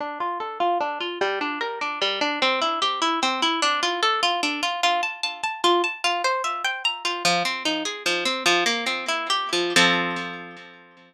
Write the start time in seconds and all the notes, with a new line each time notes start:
0.01 D4
0.20 F4
0.40 A4
0.60 F4
0.81 D4
1.01 F4
1.21 G3
1.41 D4
1.61 A#4
1.81 D4
2.02 G3
2.21 D4
2.42 C4
2.62 E4
2.82 G4
3.02 E4
3.23 C4
3.42 E4
3.62 D4
3.83 F4
4.03 A4
4.23 F4
4.43 D4
4.63 F4
4.83 F4
5.03 A5
5.23 A5
5.44 A5
5.64 F4
5.84 A5
6.04 F4
6.24 C5
6.44 E5
6.65 G5
6.85 A#5
7.05 F4
7.25 F3
7.45 C4
7.65 D#4
7.85 G#4
8.06 F3
8.25 C4
8.46 F3
8.66 A#3
8.86 C4
9.08 E4
9.30 G4
9.53 F3
9.76 F3 C4 A4